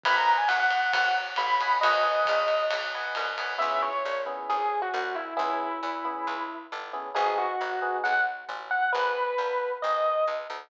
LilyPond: <<
  \new Staff \with { instrumentName = "Electric Piano 1" } { \time 4/4 \key gis \minor \tempo 4 = 135 b''16 ais''8 gis''16 fis''16 fis''8. fis''8 r8 b''4 | dis''2 r2 | e''8 cis''4 r8 gis'8. fis'8. e'8 | e'2. r4 |
gis'8 fis'4. fis''8 r4 fis''8 | b'2 dis''4 r4 | }
  \new Staff \with { instrumentName = "Electric Piano 1" } { \time 4/4 \key gis \minor <b' dis'' fis'' gis''>2.~ <b' dis'' fis'' gis''>8 <b' dis'' fis'' gis''>8 | <b' dis'' fis'' gis''>8 <b' dis'' fis'' gis''>2 <b' dis'' fis'' gis''>4 <b' dis'' fis'' gis''>8 | <b cis' e' gis'>4. <b cis' e' gis'>2~ <b cis' e' gis'>8 | <b cis' e' gis'>4. <b cis' e' gis'>2 <b cis' e' gis'>8 |
<b dis' fis' gis'>4. <b dis' fis' gis'>2~ <b dis' fis' gis'>8 | r1 | }
  \new Staff \with { instrumentName = "Electric Bass (finger)" } { \clef bass \time 4/4 \key gis \minor gis,,4 gis,,4 gis,,4 a,,4 | gis,,4 ais,,4 b,,4 c,4 | cis,4 ais,,4 gis,,4 c,4 | cis,4 e,4 cis,4 g,,4 |
gis,,4 gis,,4 b,,4 a,,4 | gis,,4 ais,,4 gis,,4 cis,8 d,8 | }
  \new DrumStaff \with { instrumentName = "Drums" } \drummode { \time 4/4 <bd cymr>4 <hhp cymr>8 cymr8 <bd cymr>4 <hhp cymr>8 cymr8 | cymr4 <hhp bd cymr>8 cymr8 cymr4 <hhp cymr>8 cymr8 | r4 r4 r4 r4 | r4 r4 r4 r4 |
r4 r4 r4 r4 | r4 r4 r4 r4 | }
>>